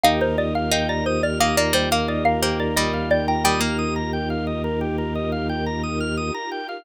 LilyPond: <<
  \new Staff \with { instrumentName = "Xylophone" } { \time 5/4 \key d \phrygian \tempo 4 = 88 f''16 c''16 d''16 f''16 f''16 d''16 c''16 d''16 f''16 d''16 c''16 f''16 d''16 f''16 c''16 d''16 ees''8 d''16 g''16 | g''2.~ g''8 r4. | }
  \new Staff \with { instrumentName = "Pizzicato Strings" } { \time 5/4 \key d \phrygian ees'8 r8 ees'4 bes16 bes16 g16 bes8. bes8 g4 | g16 bes4.~ bes16 r2. | }
  \new Staff \with { instrumentName = "Drawbar Organ" } { \time 5/4 \key d \phrygian g'16 bes'16 ees''16 f''16 g''16 bes''16 ees'''16 f'''16 ees'''16 bes''16 g''16 f''16 ees''16 bes'16 g'16 bes'16 ees''16 f''16 g''16 bes''16 | ees'''16 f'''16 ees'''16 bes''16 g''16 f''16 ees''16 bes'16 g'16 bes'16 ees''16 f''16 g''16 bes''16 ees'''16 f'''16 ees'''16 bes''16 g''16 f''16 | }
  \new Staff \with { instrumentName = "Drawbar Organ" } { \clef bass \time 5/4 \key d \phrygian ees,1~ ees,4~ | ees,1~ ees,4 | }
  \new Staff \with { instrumentName = "String Ensemble 1" } { \time 5/4 \key d \phrygian <ees' f' g' bes'>1~ <ees' f' g' bes'>4~ | <ees' f' g' bes'>1~ <ees' f' g' bes'>4 | }
>>